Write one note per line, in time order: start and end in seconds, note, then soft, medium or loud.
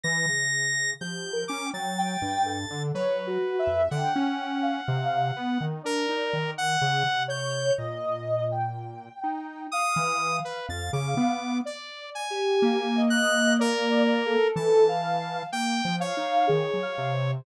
0.04 0.26 E3 loud
0.04 0.91 A#6 loud
0.28 0.94 C#3 medium
1.00 1.45 F3 medium
1.00 1.29 G4 medium
1.00 1.44 G6 medium
1.33 1.62 A#4 medium
1.48 1.71 C#4 medium
1.48 1.70 D6 medium
1.65 1.94 G5 medium
1.74 2.17 F#3 medium
1.74 2.83 A6 medium
1.98 2.42 G5 loud
2.22 2.66 G2 medium
2.45 2.89 A4 medium
2.70 2.92 D3 loud
2.95 3.38 F#3 medium
2.95 3.82 B4 medium
2.95 3.24 C#5 loud
3.27 3.56 F#4 loud
3.59 3.88 E5 loud
3.67 3.89 F2 medium
3.91 4.13 D3 loud
3.91 5.65 F#5 medium
3.91 4.57 G5 medium
4.16 4.81 C#4 loud
4.62 5.28 F5 medium
4.88 5.32 C3 loud
5.36 5.58 B3 loud
5.61 5.82 D#3 medium
5.83 6.07 D4 medium
5.83 6.51 A#4 loud
5.83 6.49 D5 medium
6.09 6.31 D#4 medium
6.33 6.77 D#3 medium
6.58 7.23 F#5 loud
6.82 7.03 C#3 loud
7.06 7.71 C3 medium
7.28 7.72 C#5 loud
7.28 7.73 G6 medium
7.78 9.09 A#2 medium
7.78 8.43 D#5 loud
8.51 9.60 G5 medium
9.24 9.67 D#4 medium
9.72 10.16 F5 loud
9.72 10.37 D#6 loud
9.96 10.40 E3 loud
10.21 11.52 F5 medium
10.45 10.66 B4 medium
10.69 10.91 F2 medium
10.69 10.91 A6 medium
10.93 11.15 C#3 loud
10.93 11.58 D6 medium
11.17 11.61 B3 loud
11.65 12.23 D5 medium
11.65 12.10 D5 medium
12.15 13.02 G#5 medium
12.30 12.88 G4 loud
12.62 14.36 A#3 loud
12.95 13.53 D#5 loud
13.10 13.54 F#6 loud
13.59 14.48 A#4 loud
13.59 14.17 D5 loud
14.26 14.84 A4 loud
14.56 15.43 E3 loud
14.56 15.43 A5 medium
14.88 15.46 F5 loud
15.52 15.82 A#3 medium
15.52 15.96 G5 loud
15.85 16.14 F3 medium
16.00 17.31 C#5 medium
16.00 16.43 F5 loud
16.17 16.46 D#4 medium
16.47 16.71 D#3 medium
16.47 16.76 G#4 medium
16.74 16.95 F#3 medium
16.82 17.11 F5 loud
16.98 17.41 C3 loud
17.13 17.42 C5 medium